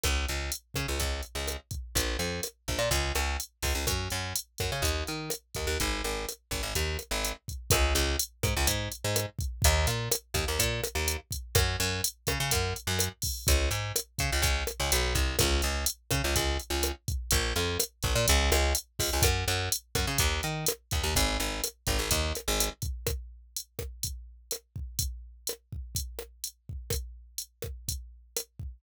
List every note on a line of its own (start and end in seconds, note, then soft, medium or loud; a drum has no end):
0.04 0.26 C#2 medium
0.04 kick loud
0.04 cross-stick loud
0.04 closed hi-hat loud
0.29 0.51 C#2 medium
0.29 closed hi-hat medium
0.52 closed hi-hat loud
0.74 0.87 C#3 medium
0.74 kick medium
0.74 cross-stick medium
0.74 closed hi-hat medium
0.88 0.99 C#2 medium
1.00 1.21 C#2 medium
1.00 kick medium
1.00 closed hi-hat loud
1.23 closed hi-hat medium
1.35 1.57 C#2 medium
1.48 cross-stick medium
1.48 closed hi-hat loud
1.71 kick loud
1.71 closed hi-hat medium
1.95 2.17 A#1 medium
1.95 kick loud
1.95 closed hi-hat loud
2.19 2.41 F2 medium
2.19 closed hi-hat medium
2.43 cross-stick medium
2.43 closed hi-hat loud
2.68 2.79 A#1 medium
2.68 kick medium
2.68 closed hi-hat medium
2.79 2.89 A#2 medium
2.91 3.12 C#2 medium
2.91 kick medium
2.91 closed hi-hat loud
3.15 3.37 C#2 medium
3.15 cross-stick loud
3.15 closed hi-hat medium
3.40 closed hi-hat loud
3.62 3.74 C#2 medium
3.62 kick medium
3.62 open hi-hat medium
3.75 3.86 C#2 medium
3.87 4.08 F#2 medium
3.87 kick loud
3.87 cross-stick loud
3.87 closed hi-hat loud
4.10 4.33 F#2 medium
4.10 closed hi-hat medium
4.36 closed hi-hat loud
4.58 4.71 F#2 medium
4.58 kick medium
4.58 cross-stick medium
4.58 closed hi-hat medium
4.72 4.83 C#3 medium
4.82 5.04 D#2 medium
4.82 kick medium
4.82 closed hi-hat loud
5.07 5.30 D#3 medium
5.07 closed hi-hat medium
5.30 cross-stick loud
5.30 closed hi-hat loud
5.55 5.67 D#2 medium
5.55 kick medium
5.55 closed hi-hat medium
5.67 5.78 D#2 medium
5.80 6.02 G#1 medium
5.80 kick medium
5.80 closed hi-hat loud
6.04 6.26 G#1 medium
6.04 closed hi-hat medium
6.29 cross-stick medium
6.29 closed hi-hat loud
6.51 6.62 G#1 medium
6.51 kick medium
6.51 closed hi-hat medium
6.63 6.74 G#1 medium
6.75 6.97 D#2 medium
6.75 kick medium
6.75 closed hi-hat loud
6.99 cross-stick medium
6.99 closed hi-hat medium
7.11 7.33 G#1 medium
7.25 closed hi-hat loud
7.48 kick medium
7.48 closed hi-hat medium
7.70 7.94 C#2 loud
7.70 kick loud
7.70 cross-stick loud
7.70 closed hi-hat loud
7.95 8.17 C#2 medium
7.95 closed hi-hat loud
8.19 closed hi-hat loud
8.43 8.54 G#2 medium
8.43 kick loud
8.43 cross-stick loud
8.43 closed hi-hat loud
8.57 8.67 C#2 medium
8.67 8.89 G#2 medium
8.67 kick medium
8.67 closed hi-hat loud
8.92 closed hi-hat medium
9.04 9.26 G#2 medium
9.16 cross-stick loud
9.16 closed hi-hat loud
9.39 kick loud
9.39 closed hi-hat medium
9.62 9.86 D#2 loud
9.62 kick loud
9.62 closed hi-hat loud
9.87 10.09 A#2 medium
9.87 closed hi-hat loud
10.12 cross-stick loud
10.12 closed hi-hat loud
10.34 10.45 D#2 medium
10.34 kick loud
10.34 closed hi-hat loud
10.48 10.59 D#2 medium
10.59 10.81 A#2 medium
10.59 kick loud
10.59 closed hi-hat loud
10.84 cross-stick loud
10.84 closed hi-hat loud
10.95 11.17 D#2 medium
11.08 closed hi-hat loud
11.31 kick medium
11.31 closed hi-hat loud
11.55 11.77 F#2 medium
11.55 kick loud
11.55 cross-stick loud
11.55 closed hi-hat loud
11.80 12.01 F#2 medium
11.80 closed hi-hat loud
12.04 closed hi-hat loud
12.27 12.38 C#3 medium
12.27 kick loud
12.27 cross-stick loud
12.27 closed hi-hat medium
12.40 12.51 C#3 medium
12.51 12.74 F#2 medium
12.51 kick loud
12.51 closed hi-hat loud
12.76 closed hi-hat medium
12.87 13.09 F#2 medium
12.99 cross-stick loud
12.99 closed hi-hat loud
13.22 kick loud
13.22 open hi-hat loud
13.47 13.70 C#2 loud
13.47 kick loud
13.47 closed hi-hat loud
13.71 13.92 G#2 medium
13.71 closed hi-hat loud
13.96 cross-stick loud
13.96 closed hi-hat loud
14.19 14.31 C#3 medium
14.19 kick loud
14.19 closed hi-hat loud
14.32 14.42 C#2 medium
14.42 14.64 C#2 medium
14.42 kick loud
14.42 closed hi-hat loud
14.67 cross-stick loud
14.67 closed hi-hat medium
14.80 14.91 C#2 medium
14.92 15.14 B1 medium
14.92 closed hi-hat loud
15.15 15.36 C2 medium
15.15 kick loud
15.15 closed hi-hat loud
15.39 15.62 C#2 loud
15.39 kick loud
15.39 cross-stick loud
15.39 closed hi-hat loud
15.62 15.85 C#2 medium
15.62 closed hi-hat medium
15.86 closed hi-hat loud
16.11 16.22 C#3 medium
16.11 kick loud
16.11 cross-stick loud
16.11 closed hi-hat loud
16.24 16.35 C#2 medium
16.36 16.58 C#2 medium
16.36 kick loud
16.36 closed hi-hat loud
16.59 closed hi-hat medium
16.70 16.92 C#2 medium
16.83 cross-stick loud
16.83 closed hi-hat loud
17.08 kick loud
17.08 closed hi-hat medium
17.31 17.53 A#1 medium
17.31 kick loud
17.31 closed hi-hat loud
17.56 17.78 F2 medium
17.56 closed hi-hat medium
17.80 cross-stick loud
17.80 closed hi-hat loud
18.03 18.14 A#1 medium
18.03 kick loud
18.03 closed hi-hat medium
18.16 18.26 A#2 loud
18.28 18.51 C#2 loud
18.28 kick loud
18.28 closed hi-hat loud
18.52 18.73 C#2 loud
18.52 cross-stick loud
18.52 closed hi-hat medium
18.75 closed hi-hat loud
18.99 19.10 C#2 medium
18.99 kick loud
18.99 open hi-hat loud
19.13 19.24 C#2 medium
19.22 19.45 F#2 medium
19.22 kick loud
19.22 cross-stick loud
19.22 closed hi-hat loud
19.48 19.69 F#2 medium
19.48 closed hi-hat loud
19.72 closed hi-hat loud
19.95 20.06 F#2 medium
19.95 kick loud
19.95 cross-stick loud
19.95 closed hi-hat medium
20.07 20.18 C#3 medium
20.18 20.41 D#2 loud
20.18 kick loud
20.18 closed hi-hat loud
20.43 20.65 D#3 medium
20.43 closed hi-hat medium
20.66 cross-stick loud
20.66 closed hi-hat loud
20.91 21.03 D#2 medium
20.91 kick loud
20.91 closed hi-hat loud
21.04 21.14 D#2 medium
21.15 21.38 G#1 loud
21.15 kick loud
21.15 closed hi-hat loud
21.40 21.61 G#1 medium
21.40 closed hi-hat medium
21.64 cross-stick loud
21.64 closed hi-hat loud
21.87 21.98 G#1 medium
21.87 kick loud
21.87 closed hi-hat loud
21.99 22.09 G#1 medium
22.11 22.33 D#2 loud
22.11 kick loud
22.11 closed hi-hat loud
22.35 cross-stick loud
22.35 closed hi-hat loud
22.48 22.69 G#1 medium
22.60 closed hi-hat loud
22.82 kick loud
22.82 closed hi-hat medium
23.07 kick loud
23.07 cross-stick loud
23.07 closed hi-hat loud
23.57 closed hi-hat loud
23.79 kick medium
23.79 cross-stick loud
24.03 kick medium
24.03 closed hi-hat loud
24.51 cross-stick medium
24.51 closed hi-hat loud
24.76 kick medium
24.99 kick loud
24.99 closed hi-hat loud
25.47 cross-stick loud
25.47 closed hi-hat loud
25.73 kick medium
25.95 kick loud
25.95 closed hi-hat loud
26.19 cross-stick loud
26.44 closed hi-hat loud
26.69 kick medium
26.90 kick loud
26.90 cross-stick loud
26.90 closed hi-hat loud
27.38 closed hi-hat loud
27.62 kick medium
27.62 cross-stick loud
27.88 kick medium
27.88 closed hi-hat loud
28.37 cross-stick loud
28.37 closed hi-hat loud
28.59 kick medium